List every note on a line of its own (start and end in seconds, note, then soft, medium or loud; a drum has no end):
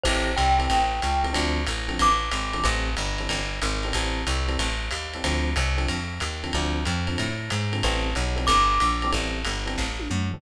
0.04 0.35 A1 medium
0.04 0.31 E3 loud
0.04 0.31 C4 medium
0.04 0.31 G4 loud
0.04 0.31 A4 loud
0.04 0.35 C5 medium
0.04 kick medium
0.04 crash medium
0.04 ride medium
0.36 0.68 C2 medium
0.36 1.32 G5 medium
0.36 hi-hat pedal medium
0.36 ride medium
0.59 0.78 E3 medium
0.59 0.78 C4 medium
0.59 0.78 G4 medium
0.59 0.78 A4 medium
0.59 ride medium
0.70 1.01 A1 medium
0.70 kick medium
0.70 ride medium
1.02 1.34 C#2 medium
1.02 hi-hat pedal medium
1.02 ride medium
1.23 1.31 E3 medium
1.23 1.31 C4 medium
1.23 1.31 G4 medium
1.23 1.31 A4 medium
1.23 ride medium
1.33 1.66 D2 medium
1.33 1.59 D3 loud
1.33 1.59 F3 loud
1.33 1.59 C4 medium
1.33 1.59 A4 loud
1.33 kick medium
1.33 ride medium
1.66 1.98 A1 medium
1.66 hi-hat pedal medium
1.66 ride medium
1.88 2.07 D3 medium
1.88 2.07 F3 medium
1.88 2.07 C4 medium
1.88 2.07 A4 medium
1.88 ride medium
1.99 2.30 A1 medium
1.99 2.66 D6 medium
1.99 kick medium
1.99 ride medium
2.31 2.63 G#1 medium
2.31 hi-hat pedal medium
2.31 ride medium
2.53 2.61 D3 medium
2.53 2.61 F3 medium
2.53 2.61 C4 medium
2.53 2.61 A4 medium
2.53 ride medium
2.63 2.95 A1 medium
2.63 2.90 E3 loud
2.63 2.90 G3 loud
2.63 2.90 C4 loud
2.63 2.90 A4 loud
2.63 kick medium
2.63 ride medium
2.97 3.28 G1 medium
2.97 hi-hat pedal medium
2.97 ride medium
3.18 3.39 E3 medium
3.18 3.39 G3 medium
3.18 3.39 C4 medium
3.18 3.39 A4 medium
3.18 ride medium
3.29 3.60 G1 medium
3.29 kick soft
3.29 ride medium
3.62 3.93 G#1 medium
3.62 hi-hat pedal medium
3.62 ride medium
3.83 3.92 E3 medium
3.83 3.92 G3 medium
3.83 3.92 C4 medium
3.83 3.92 A4 medium
3.83 ride medium
3.93 4.24 A1 medium
3.93 4.21 E3 medium
3.93 4.21 G3 loud
3.93 4.21 C4 loud
3.93 4.21 A4 loud
3.93 kick soft
3.93 ride medium
4.27 4.57 C2 medium
4.27 hi-hat pedal medium
4.27 ride medium
4.48 4.67 E3 medium
4.48 4.67 G3 medium
4.48 4.67 C4 medium
4.48 4.67 A4 medium
4.48 ride medium
4.59 4.90 A1 medium
4.59 kick medium
4.59 ride medium
4.91 5.22 D#2 medium
4.91 hi-hat pedal medium
4.91 ride medium
5.14 5.22 E3 medium
5.14 5.22 G3 medium
5.14 5.22 C4 medium
5.14 5.22 A4 medium
5.14 ride medium
5.24 5.54 D2 medium
5.24 5.50 D3 medium
5.24 5.50 F3 loud
5.24 5.50 C4 loud
5.24 5.50 A4 medium
5.24 kick medium
5.24 ride medium
5.56 5.87 C2 medium
5.56 hi-hat pedal medium
5.56 ride medium
5.77 5.96 D3 medium
5.77 5.96 F3 medium
5.77 5.96 C4 medium
5.77 5.96 A4 medium
5.77 ride medium
5.88 6.20 F2 medium
5.88 kick medium
5.88 ride medium
6.20 6.52 D#2 medium
6.20 hi-hat pedal medium
6.20 ride medium
6.44 6.51 D3 medium
6.44 6.51 F3 medium
6.44 6.51 C4 medium
6.44 6.51 A4 medium
6.44 ride medium
6.53 6.85 D2 medium
6.53 6.80 D3 loud
6.53 6.80 F3 loud
6.53 6.80 C4 medium
6.53 6.80 A4 medium
6.53 kick medium
6.53 ride medium
6.85 7.17 F2 medium
6.85 hi-hat pedal medium
6.85 ride medium
7.07 7.27 D3 medium
7.07 7.27 F3 medium
7.07 7.27 C4 medium
7.07 7.27 A4 medium
7.07 ride medium
7.18 7.50 A2 medium
7.18 kick soft
7.18 ride medium
7.50 7.82 G#2 medium
7.50 hi-hat pedal medium
7.50 ride medium
7.72 7.80 D3 medium
7.72 7.80 F3 medium
7.72 7.80 C4 medium
7.72 7.80 A4 medium
7.72 ride medium
7.83 8.14 A1 medium
7.83 8.10 E3 loud
7.83 8.10 G3 loud
7.83 8.10 C4 loud
7.83 8.10 A4 loud
7.83 kick medium
7.83 ride medium
8.15 8.47 B1 medium
8.15 hi-hat pedal medium
8.15 ride medium
8.36 8.55 E3 medium
8.36 8.55 G3 medium
8.36 8.55 C4 medium
8.36 8.55 A4 medium
8.36 ride medium
8.47 8.79 G1 medium
8.47 9.10 D6 medium
8.47 kick medium
8.47 ride loud
8.80 9.12 A#1 medium
8.80 hi-hat pedal medium
8.80 ride medium
9.02 9.11 E3 medium
9.02 9.11 G3 medium
9.02 9.11 C4 loud
9.02 9.11 A4 medium
9.02 ride medium
9.12 9.44 A1 medium
9.12 9.38 E3 loud
9.12 9.38 G3 loud
9.12 9.38 C4 medium
9.12 9.38 A4 loud
9.12 kick soft
9.12 ride medium
9.45 9.76 G1 medium
9.45 hi-hat pedal medium
9.45 ride medium
9.66 9.85 E3 medium
9.66 9.85 G3 medium
9.66 9.85 C4 medium
9.66 9.85 A4 medium
9.66 ride medium
9.78 10.08 A1 medium
9.78 kick medium
9.78 snare medium
10.00 high tom medium
10.10 10.41 F#2 medium
10.10 mid tom medium
10.31 10.41 E3 medium
10.31 10.41 G3 medium
10.31 10.41 C4 medium
10.31 10.41 A4 medium
10.31 floor tom loud